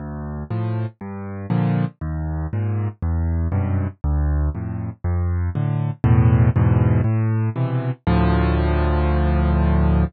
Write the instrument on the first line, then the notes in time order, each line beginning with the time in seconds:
acoustic grand piano
0.00 D2
0.51 A2 F3
1.01 G2
1.50 A#2 D3 F3
2.01 D#2
2.53 G#2 A#2
3.03 E2
3.52 F#2 G2 B2
4.04 D2
4.55 F2 A2
5.04 F2
5.55 A2 D3
6.04 E2 A2 B2
6.56 E2 G#2 B2
7.04 A2
7.56 B2 C3 E3
8.07 D2 A2 F3